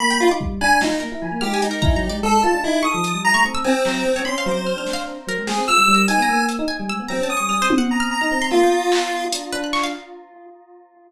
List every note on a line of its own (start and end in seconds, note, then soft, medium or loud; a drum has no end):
0.00 0.12 A#3 loud
0.00 0.18 B5 loud
0.11 0.26 A#3 medium
0.11 0.29 G5 medium
0.20 0.29 F4 loud
0.27 0.39 D#4 medium
0.31 0.59 D6 medium
0.40 0.59 G3 medium
0.40 kick medium
0.61 0.79 D4 loud
0.61 0.79 G#5 loud
0.61 0.98 F#6 medium
0.81 0.90 F#3 medium
0.81 0.99 D#4 medium
0.81 snare medium
0.91 1.00 D#4 medium
1.00 1.11 A#3 medium
1.00 1.36 A#4 medium
1.12 1.21 E4 medium
1.22 1.31 F3 medium
1.32 1.41 A#3 medium
1.41 1.60 G#3 medium
1.41 1.60 G4 medium
1.41 1.53 F6 loud
1.54 1.66 G#5 medium
1.62 1.80 G#3 medium
1.62 2.17 D#4 soft
1.62 closed hi-hat medium
1.71 1.83 A#4 medium
1.82 1.95 E4 loud
1.82 1.94 A#5 loud
1.82 kick medium
1.96 2.08 F#3 loud
1.96 2.08 A#5 medium
2.09 2.22 G#3 medium
2.09 2.22 D5 medium
2.23 2.41 G#3 loud
2.23 2.41 A4 loud
2.43 2.53 F4 loud
2.43 2.61 A5 medium
2.54 2.63 D4 medium
2.63 2.82 D#4 loud
2.63 2.82 E4 medium
2.83 2.93 D#4 soft
2.83 2.92 C#6 loud
2.83 3.20 D#6 medium
2.94 3.12 F3 medium
3.04 closed hi-hat medium
3.14 3.32 G3 medium
3.24 3.43 A#5 loud
3.34 3.43 A3 medium
3.34 3.43 C#6 loud
3.45 3.81 C4 medium
3.45 3.55 C#6 medium
3.55 3.64 E6 loud
3.64 4.19 C4 loud
3.64 3.74 G#5 medium
3.85 4.03 F#3 medium
3.85 clap medium
4.05 4.24 C4 medium
4.16 4.25 C#5 medium
4.25 4.44 C#4 medium
4.25 4.37 B5 medium
4.25 4.44 C6 medium
4.38 4.50 F5 loud
4.46 4.73 F#3 loud
4.46 5.01 C5 medium
4.51 4.63 D6 medium
4.67 4.78 F6 medium
4.77 5.13 D4 medium
4.77 4.90 F6 medium
4.86 snare medium
4.93 5.05 F5 loud
5.27 5.36 F#3 medium
5.27 5.47 A#4 loud
5.38 5.47 G#3 medium
5.47 5.56 G#3 medium
5.47 5.65 G#4 medium
5.47 5.66 G5 medium
5.47 snare medium
5.58 5.67 C4 loud
5.68 5.77 F4 medium
5.68 6.04 E6 loud
5.68 5.93 F6 loud
5.77 5.87 G3 medium
5.88 6.06 G3 loud
5.94 6.19 A#4 medium
6.08 6.17 D#4 medium
6.08 6.45 G#5 medium
6.08 closed hi-hat medium
6.18 6.27 B3 loud
6.22 6.47 A#5 medium
6.28 6.56 A#3 medium
6.49 closed hi-hat medium
6.59 6.68 D#4 loud
6.68 6.77 G#5 loud
6.79 6.88 G3 medium
6.89 6.98 G#3 medium
6.89 6.99 E6 loud
6.99 7.09 B3 medium
7.08 7.19 F#3 medium
7.08 7.28 C4 medium
7.08 7.21 A#5 medium
7.20 7.38 C#4 medium
7.20 7.35 A5 medium
7.30 7.66 D#6 medium
7.37 7.49 G3 medium
7.37 7.49 C#6 medium
7.49 7.59 G3 medium
7.49 7.61 F6 medium
7.49 cowbell medium
7.60 8.15 C4 medium
7.60 7.74 C5 loud
7.70 high tom loud
7.78 7.90 F#5 loud
7.91 8.09 A#5 medium
8.00 8.09 F6 loud
8.11 8.47 A#5 medium
8.21 8.30 D#4 loud
8.21 8.30 F6 medium
8.31 8.49 C4 loud
8.42 8.51 C6 loud
8.51 8.61 A#3 medium
8.51 9.24 F4 loud
8.51 8.60 E6 soft
8.62 9.26 B3 medium
8.62 8.72 G5 medium
8.92 9.29 B5 medium
8.92 clap medium
9.32 9.51 D4 medium
9.32 closed hi-hat loud
9.52 9.89 D4 loud
9.52 9.62 B4 loud
9.64 9.73 F#6 medium
9.73 9.82 C#6 loud
9.73 clap medium
9.83 9.93 F5 loud